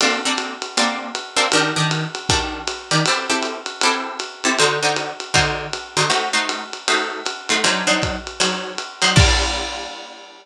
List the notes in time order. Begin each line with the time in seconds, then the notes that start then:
0.01 A#3 C4 D4 A4, ride
0.25 A#3 C4 D4 A4
0.37 hi-hat pedal, ride
0.62 ride
0.77 A#3 C4 D4 A4, ride
1.15 hi-hat pedal, ride
1.36 A#3 C4 D4 A4, ride
1.52 D#3 D4 G4 A#4, ride
1.76 D#3 D4 G4 A#4
1.91 hi-hat pedal, ride
2.15 ride
2.29 D#3 D4 G4 A#4, kick, ride
2.67 hi-hat pedal, ride
2.91 D#3 D4 G4 A#4, ride
3.06 C4 E4 G4 A4, ride
3.30 C4 E4 G4 A4
3.43 hi-hat pedal, ride
3.66 ride
3.81 C4 E4 G4 A4, ride
4.19 hi-hat pedal, ride
4.44 C4 E4 G4 A4, ride
4.59 D3 D#4 F#4 C5, ride
4.83 D3 D#4 F#4 C5
4.96 hi-hat pedal, ride
5.20 ride
5.34 D3 D#4 F#4 C5, kick, ride
5.73 hi-hat pedal, ride
5.97 D3 D#4 F#4 C5, ride
6.10 A3 D#4 F#4 C5, ride
6.33 A3 D#4 F#4 C5
6.49 hi-hat pedal, ride
6.73 ride
6.88 A3 D#4 F#4 C5, ride
7.25 hi-hat pedal, ride
7.49 A3 D#4 F#4 C5, ride
7.64 F#3 D4 D#4 C5, ride
7.87 F#3 D4 D#4 C5
8.02 kick, hi-hat pedal, ride
8.27 ride
8.40 F#3 D4 D#4 C5, ride
8.78 hi-hat pedal, ride
9.02 F#3 D4 D#4 C5, ride
9.16 G3 A#3 D4 F4, kick, crash